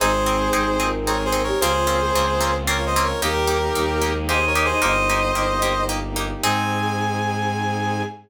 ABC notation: X:1
M:3/4
L:1/16
Q:1/4=112
K:Ab
V:1 name="Brass Section"
[Ac]8 (3[Bd]2 [Ac]2 [Bd]2 | [Ac]8 (3[Bd]2 [ce]2 [Bd]2 | [GB]8 (3[Ac]2 [Bd]2 [Ac]2 | [ce]8 z4 |
a12 |]
V:2 name="Choir Aahs"
[A,,A,]6 [B,,B,]2 [A,A]2 [B,B] [G,G] | [F,F]3 [A,A]3 z6 | [G,G]6 [A,A]2 [Ee]2 [Ee] [Ee] | [Ee]4 z8 |
A12 |]
V:3 name="Orchestral Harp"
[CEA]2 [CEA]2 [CEA]2 [CEA]2 [CEA]2 [CEA]2 | [B,CDF]2 [B,CDF]2 [B,CDF]2 [B,CDF]2 [B,CDF]2 [B,CDF]2 | [B,EG]2 [B,EG]2 [B,EG]2 [B,EG]2 [B,EG]2 [B,EG]2 | [B,EG]2 [B,EG]2 [B,EG]2 [B,EG]2 [B,EG]2 [B,EG]2 |
[CEA]12 |]
V:4 name="Violin" clef=bass
A,,,4 A,,,8 | D,,4 D,,8 | E,,4 E,,8 | G,,,4 G,,,8 |
A,,12 |]
V:5 name="Brass Section"
[CEA]12 | [B,CDF]12 | [B,EG]12 | [B,EG]12 |
[CEA]12 |]